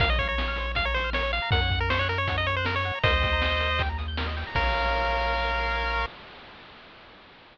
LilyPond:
<<
  \new Staff \with { instrumentName = "Lead 1 (square)" } { \time 4/4 \key bes \minor \tempo 4 = 158 f''16 ees''16 des''16 des''4~ des''16 f''16 des''16 c''8 des''8 f''8 | ges''8. bes'16 c''16 des''16 bes'16 des''8 ees''16 des''16 c''16 bes'16 des''8. | <c'' ees''>2~ <c'' ees''>8 r4. | bes'1 | }
  \new Staff \with { instrumentName = "Lead 1 (square)" } { \time 4/4 \key bes \minor bes'16 des''16 f''16 bes''16 des'''16 f'''16 c''16 des''16 f''16 bes''16 des'''16 f'''16 bes'16 des''16 f''16 bes''16 | bes'16 des''16 ges''16 bes''16 des'''16 ges'''16 bes'16 des''16 ges''16 bes''16 des'''16 ges'''16 bes'16 des''16 ges''16 bes''16 | bes'16 ees''16 g''16 bes''16 ees'''16 g'''16 bes'16 ees''16 g''16 bes''16 ees'''16 g'''16 bes'16 ees''16 g''16 bes''16 | <bes' des'' f''>1 | }
  \new Staff \with { instrumentName = "Synth Bass 1" } { \clef bass \time 4/4 \key bes \minor bes,,1 | ges,1 | ees,1 | bes,,1 | }
  \new DrumStaff \with { instrumentName = "Drums" } \drummode { \time 4/4 <hh bd>8 <hh bd>8 sn8 hh8 <hh bd>8 hh8 sn8 hh8 | <hh bd>8 <hh bd>8 sn8 hh8 <hh bd>8 hh8 sn8 hh8 | <hh bd>8 <hh bd>8 sn8 hh8 <hh bd>8 hh8 sn8 hho8 | <cymc bd>4 r4 r4 r4 | }
>>